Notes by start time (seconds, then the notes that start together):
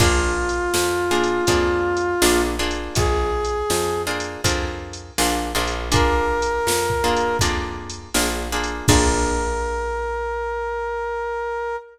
0.00 A#1 A#3 D4 F4 G#4, kick, crash
0.49 closed hi-hat
0.74 F2, snare
1.11 A#3 D4 F4 G#4
1.24 closed hi-hat
1.47 F2 A#3 D4 F4 G#4, kick, closed hi-hat
1.97 closed hi-hat
2.22 A#1 A#3 D4 F4 G#4, snare
2.59 A#3 D4 F4 G#4
2.71 closed hi-hat
2.95 A#1 G#4, kick, closed hi-hat
3.45 closed hi-hat
3.70 F2, snare
4.07 A#3 D4 F4 G#4
4.20 closed hi-hat
4.44 F2 A#3 D4 F4 G#4, kick, closed hi-hat
4.93 closed hi-hat
5.18 A#1 A#3 D4 F4 G#4, snare
5.55 A#1 A#3 D4 F4 G#4
5.67 closed hi-hat
5.92 A#3 D4 F4 G#4 A#4, kick, closed hi-hat
6.42 closed hi-hat
6.67 F2, snare
6.90 kick
7.04 A#3 D4 F4 G#4
7.17 closed hi-hat
7.39 F2 A#3 D4 F4 G#4, kick, closed hi-hat
7.90 closed hi-hat
8.14 A#1 A#3 D4 F4 G#4, snare
8.52 A#3 D4 F4 G#4
8.64 closed hi-hat
8.88 A#1 A#3 D4 F4 G#4 A#4, kick, crash